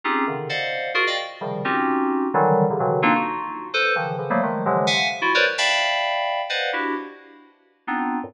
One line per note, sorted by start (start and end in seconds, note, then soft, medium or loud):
0.04 0.25 C4 medium
0.04 0.25 C#4 medium
0.04 0.25 D#4 medium
0.04 0.25 F4 medium
0.04 0.25 G4 medium
0.04 0.25 G#4 medium
0.27 0.48 C3 soft
0.27 0.48 C#3 soft
0.27 0.48 D3 soft
0.27 0.48 D#3 soft
0.49 0.91 C5 medium
0.49 0.91 D5 medium
0.49 0.91 D#5 medium
0.49 0.91 F5 medium
0.49 0.91 F#5 medium
0.94 1.05 F4 loud
0.94 1.05 F#4 loud
0.94 1.05 G#4 loud
0.94 1.05 A#4 loud
1.07 1.17 D5 medium
1.07 1.17 D#5 medium
1.07 1.17 F5 medium
1.07 1.17 G5 medium
1.41 1.62 C3 medium
1.41 1.62 C#3 medium
1.41 1.62 D#3 medium
1.41 1.62 F3 medium
1.41 1.62 G3 medium
1.65 2.27 C4 medium
1.65 2.27 C#4 medium
1.65 2.27 D#4 medium
1.65 2.27 F4 medium
1.65 2.27 F#4 medium
1.65 2.27 G4 medium
2.34 2.65 D3 loud
2.34 2.65 D#3 loud
2.34 2.65 E3 loud
2.34 2.65 F#3 loud
2.34 2.65 G3 loud
2.70 2.80 C3 medium
2.70 2.79 C#3 medium
2.70 2.79 D3 medium
2.80 3.00 B2 medium
2.80 3.00 C#3 medium
2.80 3.00 D3 medium
2.80 3.00 D#3 medium
2.80 3.00 E3 medium
2.80 3.00 F#3 medium
3.02 3.13 A#3 loud
3.02 3.13 C4 loud
3.02 3.13 D4 loud
3.02 3.13 D#4 loud
3.02 3.13 F4 loud
3.15 3.67 D#4 medium
3.15 3.67 F4 medium
3.15 3.67 F#4 medium
3.74 3.94 A4 loud
3.74 3.94 B4 loud
3.74 3.94 C5 loud
3.96 4.16 C#3 medium
3.96 4.16 D#3 medium
3.96 4.16 E3 medium
3.96 4.16 F3 medium
4.18 4.29 C#3 medium
4.18 4.29 D3 medium
4.18 4.29 E3 medium
4.18 4.29 F3 medium
4.30 4.40 F3 medium
4.30 4.40 F#3 medium
4.30 4.40 G3 medium
4.30 4.40 A3 medium
4.30 4.40 A#3 medium
4.43 4.63 D#3 medium
4.43 4.63 F3 medium
4.43 4.63 F#3 medium
4.43 4.63 G#3 medium
4.43 4.63 A3 medium
4.66 4.86 C3 medium
4.66 4.86 D3 medium
4.66 4.86 E3 medium
4.66 4.86 F3 medium
4.66 4.86 F#3 medium
4.66 4.86 G#3 medium
4.87 5.08 E5 medium
4.87 5.08 F5 medium
4.87 5.08 F#5 medium
4.87 5.08 G#5 medium
5.22 5.32 E4 loud
5.22 5.32 F4 loud
5.22 5.32 F#4 loud
5.35 5.45 A#4 loud
5.35 5.45 B4 loud
5.35 5.45 C5 loud
5.35 5.45 C#5 loud
5.35 5.45 D5 loud
5.58 6.41 D5 medium
5.58 6.41 E5 medium
5.58 6.41 F5 medium
5.58 6.41 G5 medium
5.58 6.41 A5 medium
5.58 6.41 B5 medium
6.49 6.70 B4 medium
6.49 6.70 C5 medium
6.49 6.70 D5 medium
6.49 6.70 D#5 medium
6.49 6.70 F5 medium
6.49 6.70 F#5 medium
6.73 6.94 D4 medium
6.73 6.94 E4 medium
6.73 6.94 F#4 medium
6.73 6.94 G4 medium
7.87 8.18 B3 medium
7.87 8.18 C4 medium
7.87 8.18 D4 medium
7.87 8.18 D#4 medium
7.87 8.18 F4 medium
8.23 8.34 F2 medium
8.23 8.34 F#2 medium
8.23 8.34 G2 medium
8.23 8.34 A2 medium
8.23 8.34 A#2 medium